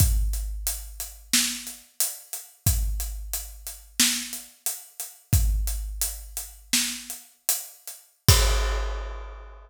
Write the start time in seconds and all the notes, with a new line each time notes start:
0.00 kick, closed hi-hat
0.33 closed hi-hat
0.67 closed hi-hat
1.00 closed hi-hat
1.33 snare
1.67 closed hi-hat
2.00 closed hi-hat
2.33 closed hi-hat
2.66 kick, closed hi-hat
3.00 closed hi-hat
3.33 closed hi-hat
3.67 closed hi-hat
4.00 snare
4.33 closed hi-hat
4.66 closed hi-hat
5.00 closed hi-hat
5.33 kick, closed hi-hat
5.67 closed hi-hat
6.01 closed hi-hat
6.37 closed hi-hat
6.73 snare
7.10 closed hi-hat
7.49 closed hi-hat
7.87 closed hi-hat
8.29 kick, crash